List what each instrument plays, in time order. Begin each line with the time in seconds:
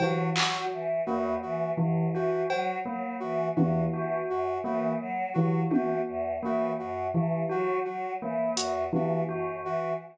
0.00 tubular bells E3, choir aahs F#3, brass section F#4, cowbell
0.35 choir aahs F#3, tubular bells F#4, brass section F#4, clap
0.72 choir aahs E3
1.06 choir aahs E2, tubular bells A#3, brass section F#4
1.42 choir aahs E3, brass section F#4
1.77 choir aahs F#2, tubular bells E3
2.14 choir aahs E3, brass section F#4, tubular bells F#4
2.49 choir aahs F#3, brass section F#4, cowbell
2.85 choir aahs F#3, tubular bells A#3
3.20 choir aahs E3, brass section F#4
3.56 choir aahs E2, tubular bells E3, brass section F#4, high tom
3.93 choir aahs E3, tubular bells F#4
4.29 choir aahs F#2, brass section F#4
4.64 choir aahs E3, tubular bells A#3, brass section F#4
5.00 choir aahs F#3
5.34 tubular bells E3, choir aahs F#3, brass section F#4
5.70 choir aahs E3, tubular bells F#4, brass section F#4, high tom
6.07 choir aahs E2
6.43 choir aahs E3, tubular bells A#3, brass section F#4
6.78 choir aahs F#2, brass section F#4
7.14 choir aahs E3, tubular bells E3
7.49 choir aahs F#3, tubular bells F#4, brass section F#4
7.85 choir aahs F#3, brass section F#4
8.21 choir aahs E3, tubular bells A#3
8.56 choir aahs E2, brass section F#4, closed hi-hat
8.93 tubular bells E3, choir aahs E3, brass section F#4, high tom
9.28 choir aahs F#2, tubular bells F#4
9.64 choir aahs E3, brass section F#4